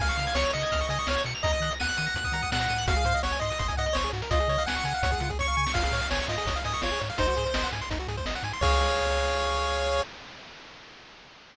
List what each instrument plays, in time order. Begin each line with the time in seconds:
0.00 synth bass 1 C#2, lead 1 (square) F5 G#5, kick, crash
0.09 lead 1 (square) C#6, closed hi-hat
0.18 synth bass 1 C#3, lead 1 (square) F6, closed hi-hat
0.27 lead 1 (square) G#6, closed hi-hat
0.35 synth bass 1 C#2, lead 1 (square) C#5 C#7, snare
0.44 lead 1 (square) F7, closed hi-hat
0.53 synth bass 1 C#3, lead 1 (square) D#5 C#7, closed hi-hat
0.62 lead 1 (square) G#6, closed hi-hat
0.72 synth bass 1 C#2, lead 1 (square) F6, kick, closed hi-hat
0.80 lead 1 (square) C#6, closed hi-hat
0.89 synth bass 1 C#3, lead 1 (square) D#5 G#5, closed hi-hat
0.99 lead 1 (square) C#6, closed hi-hat
1.07 synth bass 1 C#2, lead 1 (square) C#5 F6, snare
1.17 lead 1 (square) G#6, closed hi-hat
1.25 synth bass 1 B2, lead 1 (square) C#7, closed hi-hat
1.35 lead 1 (square) F7, closed hi-hat
1.43 synth bass 1 D#2, lead 1 (square) D#5 A#5, kick, closed hi-hat
1.53 lead 1 (square) D#6, closed hi-hat
1.60 synth bass 1 D#3, lead 1 (square) F#6, closed hi-hat
1.71 lead 1 (square) A#6, closed hi-hat
1.80 synth bass 1 D#2, lead 1 (square) F#5 D#7, snare
1.89 lead 1 (square) F#7, closed hi-hat
1.97 synth bass 1 D#3, lead 1 (square) D#7, closed hi-hat
2.06 lead 1 (square) A#6, closed hi-hat
2.15 synth bass 1 D#2, lead 1 (square) F#6, kick, closed hi-hat
2.24 lead 1 (square) D#6, kick, closed hi-hat
2.32 synth bass 1 D#3, lead 1 (square) A#5, closed hi-hat
2.42 lead 1 (square) D#6, kick, closed hi-hat
2.51 synth bass 1 A#2, lead 1 (square) F#5 F#6, snare
2.60 lead 1 (square) A#6, closed hi-hat
2.69 synth bass 1 A2, lead 1 (square) D#7, closed hi-hat
2.78 lead 1 (square) F#7, closed hi-hat
2.87 synth bass 1 G#1, lead 1 (square) F#4 F5, kick, closed hi-hat
2.96 lead 1 (square) G#4, closed hi-hat
3.05 synth bass 1 G#2, lead 1 (square) C5, closed hi-hat
3.14 lead 1 (square) D#5, closed hi-hat
3.23 synth bass 1 G#1, lead 1 (square) C#5 F#5, snare
3.32 lead 1 (square) G#5, closed hi-hat
3.40 synth bass 1 G#2, lead 1 (square) D#5 C6, closed hi-hat
3.50 lead 1 (square) D#6, closed hi-hat
3.59 synth bass 1 G1, lead 1 (square) C6, kick, closed hi-hat
3.68 lead 1 (square) G#5, kick, closed hi-hat
3.77 synth bass 1 G#2, lead 1 (square) D#5 F#5, closed hi-hat
3.86 lead 1 (square) D#5, closed hi-hat
3.93 synth bass 1 G#1, lead 1 (square) C5 C#5, snare
4.04 lead 1 (square) G#4, closed hi-hat
4.13 synth bass 1 G#2, lead 1 (square) F#4, closed hi-hat
4.22 lead 1 (square) A#4, closed hi-hat
4.31 synth bass 1 C#2, lead 1 (square) F4 D#5, kick, closed hi-hat
4.40 lead 1 (square) G#4, closed hi-hat
4.48 synth bass 1 C#3, lead 1 (square) C#5, closed hi-hat
4.58 lead 1 (square) F5, closed hi-hat
4.66 synth bass 1 C#2, lead 1 (square) F#5 G#5, snare
4.75 lead 1 (square) C#6, closed hi-hat
4.84 synth bass 1 C#3, lead 1 (square) G#5, closed hi-hat
4.94 lead 1 (square) F5, closed hi-hat
5.02 synth bass 1 C#2, lead 1 (square) C#5, kick, closed hi-hat
5.11 lead 1 (square) G#4, kick, closed hi-hat
5.20 synth bass 1 C#3, lead 1 (square) F4, closed hi-hat
5.29 lead 1 (square) G#4, kick, closed hi-hat
5.39 synth bass 1 C#2, lead 1 (square) C#5 C#6, kick, snare
5.48 lead 1 (square) F5
5.57 synth bass 1 C#3, lead 1 (square) G#5
5.66 lead 1 (square) C#6, snare
5.74 synth bass 1 G#1, lead 1 (square) F4 F5, kick, crash
5.84 lead 1 (square) G#4, closed hi-hat
5.92 synth bass 1 A2, lead 1 (square) C#5, closed hi-hat
6.01 lead 1 (square) F5, closed hi-hat
6.10 synth bass 1 G#1, lead 1 (square) C#5 G#5, snare
6.19 lead 1 (square) C#6, closed hi-hat
6.28 synth bass 1 G#2, lead 1 (square) F4 D#5, closed hi-hat
6.37 lead 1 (square) G#4, closed hi-hat
6.46 synth bass 1 G#1, lead 1 (square) C#5, kick, closed hi-hat
6.56 lead 1 (square) F5, closed hi-hat
6.64 synth bass 1 G#2, lead 1 (square) D#5 G#5, closed hi-hat
6.74 lead 1 (square) C#6, closed hi-hat
6.82 synth bass 1 G#1, lead 1 (square) F4 C#5, snare
6.92 lead 1 (square) G#4, closed hi-hat
7.01 synth bass 1 G#2, lead 1 (square) C#5, closed hi-hat
7.10 lead 1 (square) F5, closed hi-hat
7.18 synth bass 1 G#1, lead 1 (square) D#4 C5, kick, closed hi-hat
7.28 lead 1 (square) F#4, closed hi-hat
7.37 synth bass 1 G#2, lead 1 (square) G#4, closed hi-hat
7.46 lead 1 (square) C5, closed hi-hat
7.54 synth bass 1 G#1, lead 1 (square) D#5, snare
7.63 lead 1 (square) F#5, closed hi-hat
7.72 synth bass 1 G#2, lead 1 (square) G#5, closed hi-hat
7.81 lead 1 (square) C6, closed hi-hat
7.90 synth bass 1 G#1, lead 1 (square) D#4, kick, closed hi-hat
7.99 lead 1 (square) F#4, closed hi-hat
8.08 synth bass 1 G#2, lead 1 (square) G#4, closed hi-hat
8.17 lead 1 (square) C5, kick, closed hi-hat
8.26 synth bass 1 G#1, lead 1 (square) D#5, snare
8.35 lead 1 (square) F#5, closed hi-hat
8.43 synth bass 1 G#2, lead 1 (square) G#5, closed hi-hat
8.53 lead 1 (square) C6, closed hi-hat
8.61 synth bass 1 C#2, lead 1 (square) G#4 C#5 F5, kick, crash